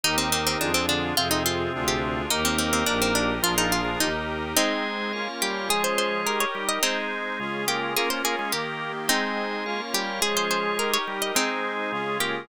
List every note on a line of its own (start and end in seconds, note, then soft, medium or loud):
0.04 0.56 D#2 medium
0.04 0.72 D#3 medium
0.04 0.59 D#4 medium
0.04 0.60 D#4 medium
0.04 0.72 D#4 loud
0.04 0.16 D#4 loud
0.04 0.59 G4 medium
0.04 0.60 G4 medium
0.04 0.59 A#4 medium
0.04 0.60 A#4 medium
0.18 0.30 C4 medium
0.32 0.45 C4 loud
0.47 0.58 C4 loud
0.60 1.12 F2 loud
0.60 1.16 D4 medium
0.60 0.73 D4 medium
0.60 1.16 F4 medium
0.60 1.16 G#4 medium
0.74 0.86 C4 loud
0.88 1.15 D3 medium
0.88 1.15 D4 loud
0.88 1.13 D4 loud
1.16 1.68 F2 loud
1.16 2.22 C3 medium
1.16 1.72 C4 medium
1.16 1.74 C4 medium
1.16 2.22 C4 loud
1.16 1.72 F4 medium
1.16 1.29 F4 loud
1.16 1.73 F4 medium
1.16 1.72 G#4 medium
1.16 1.73 G#4 medium
1.31 1.43 D#4 loud
1.46 1.73 F4 loud
1.74 2.26 D2 loud
1.74 2.29 D4 medium
1.74 2.30 D4 medium
1.74 2.29 F4 medium
1.74 2.30 F4 medium
1.74 2.29 G#4 medium
1.74 2.30 G#4 medium
1.88 2.15 G4 loud
2.30 2.83 D#2 loud
2.30 3.33 A#3 loud
2.30 2.86 D#4 medium
2.30 2.44 D#4 loud
2.30 2.87 D#4 medium
2.30 2.86 G4 medium
2.30 2.87 G4 medium
2.30 2.86 A#4 medium
2.30 2.87 A#4 medium
2.30 3.33 A#4 loud
2.45 2.57 C4 loud
2.58 2.72 C4 medium
2.73 2.85 C4 loud
2.86 3.39 A#1 loud
2.86 3.00 D4 loud
2.86 3.42 D#4 medium
2.86 3.43 D#4 medium
2.86 3.42 G4 medium
2.86 3.43 G4 medium
2.86 3.42 A#4 medium
2.86 3.43 A#4 medium
3.02 3.14 C4 loud
3.15 3.39 D4 medium
3.43 3.96 A#1 medium
3.43 3.55 F3 loud
3.43 3.99 D4 medium
3.43 4.00 D4 medium
3.43 3.55 F4 loud
3.43 3.99 F4 medium
3.43 3.56 F4 loud
3.43 4.00 F4 medium
3.43 3.99 G#4 medium
3.43 4.00 G#4 medium
3.43 3.99 A#4 medium
3.43 4.00 A#4 medium
3.57 3.81 F3 medium
3.57 3.72 D#4 loud
3.57 3.81 F4 loud
3.72 3.96 F4 loud
3.85 4.09 F3 medium
3.85 4.09 F4 medium
4.00 4.53 D#2 medium
4.00 4.55 D#4 medium
4.00 4.38 D#4 loud
4.00 4.57 D#4 medium
4.00 4.55 G4 medium
4.00 4.57 G4 medium
4.00 4.55 A#4 medium
4.00 4.57 A#4 medium
4.57 5.12 G#3 medium
4.57 5.28 G#3 loud
4.57 5.27 C4 loud
4.57 5.12 C4 medium
4.57 5.27 D#4 loud
4.57 5.12 D#4 medium
4.57 5.13 G#4 medium
4.57 5.28 G#4 loud
4.57 5.13 C5 medium
4.57 5.13 D#5 medium
5.13 5.69 A#3 medium
5.13 5.69 C#4 medium
5.13 5.69 F4 medium
5.13 5.69 A#4 medium
5.13 5.69 C#5 medium
5.13 5.69 F5 medium
5.42 5.69 G3 loud
5.42 5.69 G4 loud
5.69 6.25 F3 medium
5.69 6.45 G#3 loud
5.69 6.25 C#4 medium
5.69 6.26 F4 medium
5.69 6.45 G#4 loud
5.69 6.25 G#4 medium
5.69 6.26 G#4 medium
5.69 5.83 G#4 loud
5.69 6.26 C#5 medium
5.84 5.96 C5 loud
5.98 6.22 C5 loud
6.26 6.82 D#4 medium
6.26 6.82 G4 medium
6.26 6.82 A#4 medium
6.26 6.39 A#4 medium
6.40 6.65 C#5 loud
6.55 6.79 G3 medium
6.55 6.79 G4 medium
6.69 6.82 D#5 loud
6.83 7.65 G#3 loud
6.83 7.39 G#3 medium
6.83 7.65 C4 medium
6.83 7.39 C4 medium
6.83 7.65 D#4 loud
6.83 7.39 D#4 medium
6.83 7.65 G#4 loud
6.83 7.39 C5 medium
7.40 7.96 C#3 medium
7.40 7.96 G#3 medium
7.40 7.95 C#4 medium
7.40 7.95 F4 medium
7.40 7.96 F4 medium
7.40 7.95 G#4 medium
7.68 7.94 A#3 medium
7.68 7.93 G4 loud
7.68 7.94 A#4 loud
7.96 8.52 A#3 medium
7.96 8.10 A#3 loud
7.96 8.53 A#3 medium
7.96 8.52 C#4 medium
7.96 8.54 C#4 medium
7.96 8.52 F4 medium
7.96 8.54 F4 medium
7.96 8.08 G#4 loud
7.96 8.10 A#4 loud
8.10 8.22 A#3 medium
8.10 8.22 A#4 loud
8.10 8.22 C5 medium
8.24 8.36 A#3 loud
8.24 8.49 G#4 loud
8.24 8.36 A#4 loud
8.39 8.52 G#3 medium
8.39 8.52 G#4 loud
8.52 9.08 D#3 medium
8.52 9.09 D#3 medium
8.52 8.92 A#3 medium
8.52 9.08 A#3 medium
8.52 9.09 A#3 medium
8.52 8.77 G4 loud
8.52 9.08 G4 medium
8.52 9.09 G4 medium
8.52 8.92 A#4 medium
9.08 9.65 G#3 medium
9.08 9.81 G#3 loud
9.08 9.80 C4 loud
9.08 9.65 C4 medium
9.08 9.80 D#4 loud
9.08 9.65 D#4 medium
9.08 9.64 G#4 medium
9.08 9.81 G#4 loud
9.08 9.64 C5 medium
9.08 9.64 D#5 medium
9.66 10.22 A#3 medium
9.66 10.22 C#4 medium
9.66 10.22 F4 medium
9.66 10.22 A#4 medium
9.66 10.21 C#5 medium
9.66 10.22 F5 medium
9.94 10.20 G3 loud
9.94 10.20 G4 loud
9.94 10.22 G4 loud
10.22 10.78 F3 medium
10.22 10.98 G#3 loud
10.22 10.78 C#4 medium
10.22 10.78 F4 medium
10.22 10.78 G#4 medium
10.22 10.98 G#4 loud
10.22 10.35 G#4 loud
10.22 10.78 G#4 medium
10.22 10.78 C#5 medium
10.37 10.49 C5 loud
10.51 10.75 C5 loud
10.79 11.35 D#4 medium
10.79 11.36 D#4 medium
10.79 11.35 G4 medium
10.79 11.36 G4 medium
10.79 10.91 A#4 medium
10.79 11.35 A#4 medium
10.79 11.36 A#4 medium
10.94 11.18 C#5 loud
11.07 11.32 G3 medium
11.07 11.32 G4 medium
11.22 11.35 D#5 loud
11.35 12.18 G#3 loud
11.35 11.91 G#3 medium
11.35 11.92 G#3 medium
11.35 12.18 C4 medium
11.35 11.92 C4 medium
11.35 11.91 D#4 medium
11.35 12.18 D#4 loud
11.35 11.92 D#4 medium
11.35 12.18 G#4 loud
11.35 11.91 C5 medium
11.92 12.48 C#3 medium
11.92 12.48 G#3 medium
11.92 12.48 C#4 medium
11.92 12.48 F4 medium
11.92 12.48 G#4 medium
12.20 12.45 A#3 medium
12.20 12.46 G4 loud
12.20 12.45 A#4 loud